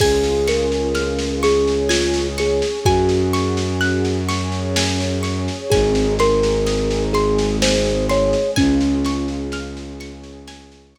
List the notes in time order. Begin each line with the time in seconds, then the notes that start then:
0.00 C#2 C#4 F4 G#4 G#5, kick, snare, crash
0.24 snare
0.47 A#4 C#6, snare
0.72 snare
0.95 F6, snare
1.18 snare
1.43 C#4 G#4 C#5 C#6, snare
1.67 snare
1.89 F4 G#5, snare
2.14 snare
2.38 G#4 C#6, snare
2.62 snare
2.85 F#2 C#4 F#4 G#4 G#5, kick, snare
3.09 snare
3.33 C#6, snare
3.57 snare
3.81 F#6, snare
4.05 snare
4.29 C#4 G#4 C#5 C#6, snare
4.52 snare
4.76 G#5, snare
5.00 snare
5.23 C#6, snare
5.48 snare
5.70 G#1 C4 D#4 G#4 G#5, kick, snare
5.95 snare
6.19 A#4 C6, snare
6.43 snare
6.66 D#6, snare
6.91 snare
7.13 G#3 C4 G#4 C6, snare
7.38 snare
7.62 C5 G#5, snare
7.86 snare
8.09 C#5 C6, snare
8.33 snare
8.56 C#2 C#4 F4 G#4 G#5, kick, snare
8.81 snare
9.05 C#6, snare
9.28 snare
9.52 F6, snare
9.77 snare
10.00 C#4 G#4 C#5 C#6, snare
10.23 snare
10.47 G#5, snare
10.72 snare
10.95 C#6, snare